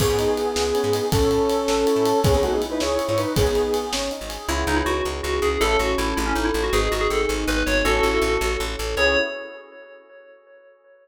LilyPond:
<<
  \new Staff \with { instrumentName = "Lead 1 (square)" } { \time 6/8 \key cis \minor \tempo 4. = 107 <b gis'>2. | <cis' a'>2. | <b gis'>16 <b gis'>16 <a fis'>16 <b gis'>16 r16 <dis' b'>16 <e' cis''>8. <e' cis''>16 <dis' b'>8 | <b gis'>4. r4. |
r2. | r2. | r2. | r2. |
r2. | }
  \new Staff \with { instrumentName = "Tubular Bells" } { \time 6/8 \key cis \minor r2. | r2. | r2. | r2. |
e'8 dis'16 e'16 fis'8 r8 fis'8 gis'8 | a'8 fis'8 e'8 e'16 cis'16 dis'16 e'16 e'16 fis'16 | gis'8 fis'16 gis'16 a'8 r8 b'8 cis''8 | <fis' a'>2 r4 |
cis''4. r4. | }
  \new Staff \with { instrumentName = "Electric Piano 1" } { \time 6/8 \key cis \minor cis'8 dis'8 e'8 gis'8 cis'8 dis'8 | cis'8 e'8 a'8 cis'8 e'8 a'8 | cis'8 dis'8 e'8 gis'8 cis'8 dis'8 | cis'8 dis'8 gis'8 cis'8 dis'8 gis'8 |
<b cis' e' gis'>2. | <cis' e' a'>2. | <b dis' gis'>2. | <cis' e' a'>2. |
<b cis' e' gis'>4. r4. | }
  \new Staff \with { instrumentName = "Electric Bass (finger)" } { \clef bass \time 6/8 \key cis \minor cis,16 gis,4~ gis,16 cis,8. gis,8. | a,,16 a,4~ a,16 a,,8. a,8. | cis,16 cis,4~ cis,16 cis,8. gis,8. | gis,,16 gis,,4~ gis,,16 gis,,8. gis,,8. |
cis,8 cis,8 cis,8 cis,8 cis,8 cis,8 | a,,8 a,,8 a,,8 a,,8 a,,8 a,,8 | gis,,8 gis,,8 gis,,8 gis,,8 gis,,8 gis,,8 | a,,8 a,,8 a,,8 a,,8 a,,8 a,,8 |
cis,4. r4. | }
  \new DrumStaff \with { instrumentName = "Drums" } \drummode { \time 6/8 <cymc bd>8 cymr8 cymr8 sn8 cymr8 cymr8 | <bd cymr>8 cymr8 cymr8 sn8 cymr8 cymr8 | <bd cymr>8 cymr8 cymr8 sn8 cymr8 cymr8 | <bd cymr>8 cymr8 cymr8 sn8 cymr8 cymr8 |
r4. r4. | r4. r4. | r4. r4. | r4. r4. |
r4. r4. | }
>>